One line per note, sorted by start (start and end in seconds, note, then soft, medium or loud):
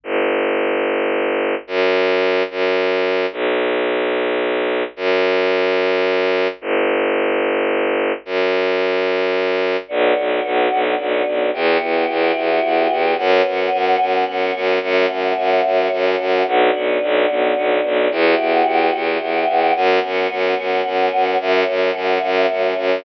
0.04 1.55 G1 medium
1.67 2.43 F#2 loud
2.50 3.26 F#2 medium
3.32 4.83 B1 medium
4.96 6.48 F#2 loud
6.61 8.12 G1 loud
8.25 9.77 F#2 medium
9.88 10.13 B1 loud
9.88 11.51 B3 medium
9.88 11.51 D4 medium
9.88 11.51 F#4 medium
10.17 10.41 B1 medium
10.45 10.68 B1 medium
10.72 10.95 B1 medium
10.99 11.23 B1 medium
11.27 11.50 B1 medium
11.53 11.78 E2 loud
11.53 13.16 B3 medium
11.53 13.16 E4 medium
11.53 13.16 F#4 medium
11.53 13.16 G4 medium
11.82 12.05 E2 medium
12.09 12.32 E2 medium
12.36 12.60 E2 medium
12.64 12.87 E2 medium
12.91 13.15 E2 medium
13.17 13.42 F#2 loud
13.17 14.80 B3 medium
13.17 14.80 C#4 medium
13.17 14.80 F#4 medium
13.46 13.70 F#2 medium
13.73 13.96 F#2 medium
14.01 14.24 F#2 medium
14.28 14.52 F#2 medium
14.55 14.79 F#2 medium
14.83 15.06 F#2 loud
14.83 16.46 A3 medium
14.83 16.46 C#4 medium
14.83 16.46 F#4 medium
15.10 15.33 F#2 medium
15.38 15.61 F#2 medium
15.65 15.88 F#2 medium
15.92 16.16 F#2 medium
16.20 16.43 F#2 medium
16.47 16.70 B1 loud
16.47 18.10 B3 medium
16.47 18.11 D4 medium
16.47 18.10 F#4 medium
16.75 16.98 B1 medium
17.03 17.26 B1 loud
17.30 17.53 B1 medium
17.57 17.80 B1 medium
17.84 18.08 B1 medium
18.11 18.35 E2 loud
18.11 19.74 B3 medium
18.11 19.74 E4 medium
18.11 19.74 F#4 medium
18.11 19.74 G4 medium
18.39 18.63 E2 medium
18.67 18.90 E2 medium
18.95 19.18 E2 medium
19.21 19.44 E2 medium
19.48 19.72 E2 medium
19.75 19.99 F#2 loud
19.75 21.38 B3 medium
19.75 21.38 C#4 medium
19.75 21.38 F#4 medium
20.04 20.27 F#2 medium
20.31 20.54 F#2 medium
20.58 20.82 F#2 medium
20.86 21.09 F#2 medium
21.13 21.36 F#2 medium
21.40 21.64 F#2 loud
21.40 23.04 A3 medium
21.40 23.04 C#4 medium
21.40 23.04 F#4 medium
21.68 21.91 F#2 medium
21.95 22.18 F#2 medium
22.23 22.46 F#2 loud
22.51 22.74 F#2 medium
22.77 23.01 F#2 medium